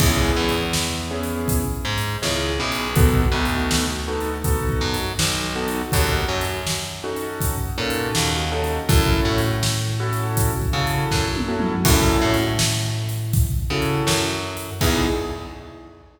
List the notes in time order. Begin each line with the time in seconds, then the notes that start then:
0.00 C#2 B3 C#4 E4 G#4, kick, crash
0.36 E2
0.49 closed hi-hat
0.73 snare
1.11 B3 C#4 E4 G#4
1.23 closed hi-hat
1.48 kick, closed hi-hat
1.85 G#2
1.98 closed hi-hat
2.22 C#2 B3 C#4 E4 G#4, snare
2.59 B1 B3 C#4 E4 G#4
2.72 closed hi-hat
2.96 B3 D#4 F#4 A4, kick, closed hi-hat
3.32 D2 B3 D#4 F#4 A4
3.45 closed hi-hat
3.71 snare
4.08 B3 D#4 F#4 A4
4.20 closed hi-hat
4.44 B3 D#4 F#4 A4, kick, closed hi-hat
4.69 kick
4.81 F#2
4.94 closed hi-hat
5.19 B1, snare
5.56 B3 D#4 F#4 A4
5.68 closed hi-hat
5.92 D#2 C#4 D#4 F#4 A4, kick, closed hi-hat
6.28 F#2
6.41 closed hi-hat
6.67 snare
7.04 C#4 D#4 F#4 A4
7.16 closed hi-hat
7.41 kick, closed hi-hat
7.78 A#2 C#4 D#4 F#4 A4
7.90 closed hi-hat
8.15 D#2, snare
8.52 C#4 D#4 F#4 A4
8.64 closed hi-hat
8.89 F#2 C#4 E4 F#4 A4, kick, closed hi-hat
9.25 A2
9.38 closed hi-hat
9.63 snare
10.00 C#4 E4 F#4 A4
10.13 closed hi-hat
10.37 kick, closed hi-hat
10.62 kick
10.73 C#3 C#4 E4 F#4 A4
10.87 closed hi-hat
11.11 F#2, kick, snare
11.36 high tom
11.48 C#4 E4 F#4 A4
11.60 mid tom
11.85 F#2 C#4 E4 F#4 A4, kick, crash
12.22 A2
12.34 closed hi-hat
12.59 snare
13.09 closed hi-hat
13.33 kick, closed hi-hat
13.70 C#3 C#4 E4 F#4 A4
13.82 closed hi-hat
14.07 F#2, snare
14.57 closed hi-hat
14.81 E2 B3 D#4 E4 G#4, kick, crash